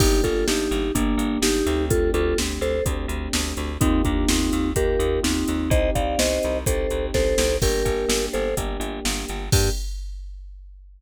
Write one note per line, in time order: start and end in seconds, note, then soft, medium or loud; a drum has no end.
0.00 0.21 G1 loud
0.00 0.85 A#3 loud
0.00 0.85 D4 loud
0.00 0.22 D#4 medium
0.00 0.22 G4 medium
0.00 0.85 G4 loud
0.00 kick loud
0.00 crash loud
0.24 0.44 G1 medium
0.24 0.46 F4 medium
0.24 0.46 A4 medium
0.24 kick medium
0.24 closed hi-hat medium
0.48 0.68 G1 medium
0.48 0.92 D#4 medium
0.48 0.92 G4 medium
0.48 snare loud
0.71 0.91 G1 loud
0.71 closed hi-hat medium
0.95 1.16 G1 medium
0.95 1.39 A#3 medium
0.95 1.64 A#3 loud
0.95 1.39 D4 medium
0.95 1.64 D4 loud
0.95 1.64 G4 loud
0.95 kick medium
0.95 closed hi-hat loud
1.17 1.38 G1 medium
1.17 closed hi-hat medium
1.42 1.62 G1 medium
1.42 1.85 D#4 medium
1.42 1.85 G4 medium
1.42 snare loud
1.66 2.11 D2 loud
1.66 2.76 A3 loud
1.66 2.76 C4 loud
1.66 2.76 D4 loud
1.66 2.76 G4 loud
1.66 closed hi-hat medium
1.90 2.11 F4 medium
1.90 2.11 A4 medium
1.90 kick loud
1.90 closed hi-hat loud
2.14 2.34 D2 loud
2.14 2.37 F4 medium
2.14 2.37 A4 medium
2.14 closed hi-hat medium
2.38 2.59 D2 medium
2.38 snare medium
2.61 2.81 D2 medium
2.61 2.84 A4 medium
2.61 2.84 C5 medium
2.61 closed hi-hat medium
2.85 3.06 D2 medium
2.85 3.71 A3 loud
2.85 3.71 C4 loud
2.85 3.71 D4 loud
2.85 3.71 G4 medium
2.85 kick medium
2.85 closed hi-hat medium
3.08 3.28 D2 medium
3.08 closed hi-hat medium
3.33 3.54 D2 medium
3.33 snare loud
3.57 3.78 D2 medium
3.57 closed hi-hat medium
3.81 4.02 D#2 loud
3.81 4.67 A#3 loud
3.81 4.02 C4 medium
3.81 4.02 D#4 loud
3.81 4.67 D#4 loud
3.81 4.67 F4 loud
3.81 4.67 G4 loud
3.81 kick loud
3.81 closed hi-hat loud
4.05 4.26 D#2 medium
4.05 4.28 A#3 medium
4.05 4.28 D4 medium
4.05 kick medium
4.05 closed hi-hat medium
4.28 4.50 D#2 medium
4.28 4.71 C4 medium
4.28 4.71 D#4 medium
4.28 snare loud
4.53 4.73 D#2 medium
4.53 closed hi-hat medium
4.76 4.96 D#2 medium
4.76 5.62 A#3 medium
4.76 5.62 D#4 loud
4.76 5.62 F4 medium
4.76 5.62 G4 loud
4.76 5.20 G4 medium
4.76 5.20 A#4 medium
4.76 kick medium
4.76 closed hi-hat loud
4.99 5.20 D#2 loud
4.99 closed hi-hat medium
5.23 5.44 D#2 medium
5.23 5.70 C4 medium
5.23 5.70 D#4 medium
5.23 snare loud
5.48 5.69 D#2 medium
5.48 closed hi-hat medium
5.70 5.90 C2 loud
5.70 6.57 C4 loud
5.70 6.57 D#4 loud
5.70 6.57 G4 loud
5.70 5.90 C5 medium
5.70 5.90 D#5 medium
5.70 kick loud
5.70 closed hi-hat medium
5.95 6.16 C2 medium
5.95 6.19 D5 medium
5.95 6.19 F5 medium
5.95 kick medium
5.95 closed hi-hat medium
6.19 6.39 C2 medium
6.19 6.58 C5 medium
6.19 6.58 D#5 medium
6.19 snare loud
6.43 6.65 C2 medium
6.43 closed hi-hat medium
6.66 6.87 C2 medium
6.66 7.53 C4 loud
6.66 7.53 D#4 medium
6.66 7.53 G4 medium
6.66 7.06 A4 medium
6.66 7.06 C5 medium
6.66 kick medium
6.66 closed hi-hat loud
6.90 7.11 C2 medium
6.90 closed hi-hat medium
7.14 7.35 C2 medium
7.14 7.57 A4 medium
7.14 7.57 C5 medium
7.14 kick medium
7.14 snare medium
7.38 7.58 C2 loud
7.38 snare loud
7.62 7.83 G1 medium
7.62 8.48 A#3 loud
7.62 8.48 D4 loud
7.62 8.48 G4 loud
7.62 8.26 G4 medium
7.62 8.26 A#4 medium
7.62 kick medium
7.62 crash medium
7.85 8.05 G1 medium
7.85 kick medium
7.85 closed hi-hat medium
8.09 8.29 G1 medium
8.09 snare loud
8.33 8.54 G1 medium
8.33 8.55 A4 medium
8.33 8.55 C5 medium
8.33 closed hi-hat medium
8.57 8.77 G1 medium
8.57 9.43 A#3 loud
8.57 9.43 D4 medium
8.57 9.43 G4 loud
8.57 kick medium
8.57 closed hi-hat medium
8.80 9.00 G1 medium
8.80 closed hi-hat medium
9.05 9.25 G1 loud
9.05 snare loud
9.28 9.50 G1 medium
9.28 closed hi-hat medium
9.52 9.70 G2 loud
9.52 9.69 A#3 loud
9.52 9.69 D4 medium
9.52 9.69 G4 medium
9.52 9.70 G4 loud
9.52 kick loud
9.52 crash loud